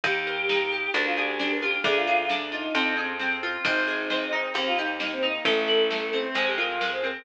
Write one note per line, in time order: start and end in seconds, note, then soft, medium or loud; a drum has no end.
0.03 0.87 D#2 loud
0.03 0.48 D#4 medium
0.03 0.89 G4 medium
0.03 kick loud
0.03 closed hi-hat medium
0.27 0.91 A#4 medium
0.49 0.92 D#4 medium
0.49 snare loud
0.72 0.93 G4 medium
0.94 1.77 D2 medium
0.94 1.39 D4 medium
0.94 1.05 A#4 medium
0.94 closed hi-hat medium
1.05 1.16 F4 medium
1.16 1.38 G4 medium
1.16 1.81 G#4 medium
1.39 1.82 D4 medium
1.39 1.50 G4 medium
1.39 snare medium
1.50 1.61 A#4 medium
1.62 1.83 F4 medium
1.62 1.80 G4 medium
1.84 2.67 D2 medium
1.84 2.29 D4 loud
1.84 1.95 G#4 medium
1.84 kick loud
1.84 closed hi-hat medium
1.95 2.06 F4 medium
2.07 2.18 F4 medium
2.07 2.71 G#4 medium
2.18 2.29 F4 medium
2.29 2.72 D4 medium
2.29 snare loud
2.52 2.93 D#4 medium
2.52 2.73 F4 medium
2.75 3.58 F2 loud
2.75 3.19 C4 medium
2.75 closed hi-hat loud
2.97 3.61 G#4 medium
3.19 3.62 C4 medium
3.19 snare medium
3.43 3.64 F4 medium
3.65 4.48 G#1 loud
3.65 4.09 C4 loud
3.65 4.37 D#4 medium
3.65 kick loud
3.65 closed hi-hat loud
3.87 4.52 G#4 medium
4.10 4.53 C4 medium
4.10 snare medium
4.32 4.53 D#4 medium
4.54 5.38 D#2 medium
4.54 4.99 A#3 medium
4.54 4.66 C4 medium
4.54 closed hi-hat loud
4.66 4.77 F4 medium
4.77 4.97 D#4 medium
4.77 5.42 G4 medium
5.00 5.43 A#3 medium
5.00 5.11 D#4 medium
5.00 snare loud
5.11 5.22 C4 medium
5.22 5.44 D#4 medium
5.22 5.43 D#4 medium
5.45 6.28 A1 loud
5.45 5.90 A3 medium
5.45 6.18 A4 medium
5.45 kick medium
5.45 closed hi-hat loud
5.67 6.32 E4 medium
5.90 6.33 A3 medium
5.90 snare loud
6.13 6.34 C4 medium
6.34 7.18 F2 medium
6.34 6.80 G#3 medium
6.34 6.46 C5 medium
6.34 closed hi-hat medium
6.47 6.57 G4 medium
6.57 7.22 F4 medium
6.57 6.78 A#4 medium
6.81 7.23 G#3 medium
6.81 6.91 A#4 medium
6.81 snare loud
6.92 7.03 C5 medium
7.03 7.25 C4 medium
7.03 7.21 A#4 medium